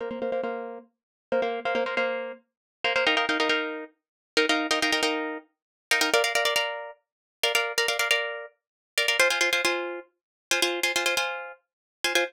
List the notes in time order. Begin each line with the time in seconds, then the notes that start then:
0.01 A#3 C5 F5
0.11 A#3 C5 F5
0.22 A#3 C5 F5
0.32 A#3 C5 F5
0.43 A#3 C5 F5
1.32 A#3 C5 F5
1.42 A#3 C5 F5
1.65 A#3 C5 F5
1.75 A#3 C5 F5
1.86 A#3 C5 F5
1.97 A#3 C5 F5
2.84 A#3 C5 F5
2.96 A#3 C5 F5
3.07 D#4 A#4 F5 G5
3.17 D#4 A#4 F5 G5
3.29 D#4 A#4 F5 G5
3.40 D#4 A#4 F5 G5
3.49 D#4 A#4 F5 G5
4.37 D#4 A#4 F5 G5
4.49 D#4 A#4 F5 G5
4.71 D#4 A#4 F5 G5
4.82 D#4 A#4 F5 G5
4.92 D#4 A#4 F5 G5
5.03 D#4 A#4 F5 G5
5.91 D#4 A#4 F5 G5
6.01 D#4 A#4 F5 G5
6.14 A#4 D5 F5
6.24 A#4 D5 F5
6.35 A#4 D5 F5
6.45 A#4 D5 F5
6.56 A#4 D5 F5
7.43 A#4 D5 F5
7.55 A#4 D5 F5
7.78 A#4 D5 F5
7.88 A#4 D5 F5
7.99 A#4 D5 F5
8.11 A#4 D5 F5
8.98 A#4 D5 F5
9.08 A#4 D5 F5
9.20 F4 C5 G#5
9.30 F4 C5 G#5
9.41 F4 C5 G#5
9.53 F4 C5 G#5
9.65 F4 C5 G#5
10.51 F4 C5 G#5
10.62 F4 C5 G#5
10.83 F4 C5 G#5
10.96 F4 C5 G#5
11.06 F4 C5 G#5
11.17 F4 C5 G#5
12.04 F4 C5 G#5
12.15 F4 C5 G#5